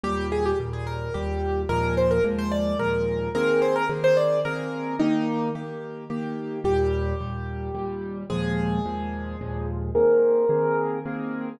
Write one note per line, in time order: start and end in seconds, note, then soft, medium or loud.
0.03 0.53 D#2 medium
0.03 0.53 A#2 medium
0.03 0.53 G3 medium
0.03 0.27 G4 loud
0.32 0.45 G#4 loud
0.45 0.58 G4 medium
0.60 1.09 D#2 medium
0.60 1.09 A#2 medium
0.60 1.09 G3 medium
0.73 0.86 G#4 medium
0.87 1.14 A#4 medium
1.14 1.65 D#2 medium
1.14 1.65 A#2 medium
1.14 1.65 G3 medium
1.14 1.61 G4 medium
1.69 2.19 D#2 medium
1.69 2.19 A#2 medium
1.69 2.19 F3 medium
1.69 2.19 G#3 medium
1.69 1.95 A#4 loud
1.97 2.10 C5 medium
2.11 2.24 A#4 medium
2.24 2.74 D#2 medium
2.24 2.74 A#2 medium
2.24 2.74 F3 medium
2.24 2.74 G#3 medium
2.38 2.51 C5 loud
2.51 2.78 D5 medium
2.79 3.29 D#2 medium
2.79 3.29 A#2 medium
2.79 3.29 F3 medium
2.79 3.29 G#3 medium
2.79 3.29 A#4 medium
3.35 3.84 D#3 medium
3.35 3.84 A#3 medium
3.35 3.84 C4 medium
3.35 3.84 G#4 medium
3.35 3.60 A#4 loud
3.62 3.75 C5 medium
3.76 3.89 A#4 loud
3.89 4.39 D#3 medium
3.89 4.39 A#3 medium
3.89 4.39 C4 medium
3.89 4.39 G#4 medium
4.04 4.17 C5 loud
4.17 4.40 D5 medium
4.45 4.94 D#3 medium
4.45 4.94 A#3 medium
4.45 4.94 C4 medium
4.45 4.94 G#4 medium
4.45 4.96 A#4 medium
4.99 5.50 D#3 medium
4.99 5.50 A#3 medium
4.99 5.48 D#4 loud
4.99 5.50 G4 medium
5.55 6.05 D#3 medium
5.55 6.05 A#3 medium
5.55 6.05 G4 medium
6.10 6.59 D#3 medium
6.10 6.59 A#3 medium
6.10 6.59 G4 medium
6.64 7.14 D#2 medium
6.64 7.14 A#2 medium
6.64 7.14 G3 medium
6.64 8.17 G4 loud
7.21 7.70 D#2 medium
7.21 7.70 A#2 medium
7.21 7.70 G3 medium
7.75 8.24 D#2 medium
7.75 8.24 A#2 medium
7.75 8.24 G3 medium
8.30 8.79 D#2 medium
8.30 8.79 A#2 medium
8.30 8.79 F3 medium
8.30 8.79 G#3 medium
8.30 9.68 G#4 loud
8.86 9.35 D#2 medium
8.86 9.35 A#2 medium
8.86 9.35 F3 medium
8.86 9.35 G#3 medium
9.41 9.91 D#2 medium
9.41 9.91 A#2 medium
9.41 9.91 F3 medium
9.41 9.91 G#3 medium
9.95 10.45 D#3 medium
9.95 10.45 A#3 medium
9.95 10.45 C4 medium
9.95 10.45 G#4 medium
9.95 11.49 A#4 loud
10.49 10.99 D#3 medium
10.49 10.99 A#3 medium
10.49 10.99 C4 medium
10.49 10.99 G#4 medium
11.06 11.55 D#3 medium
11.06 11.55 A#3 medium
11.06 11.55 C4 medium
11.06 11.55 G#4 medium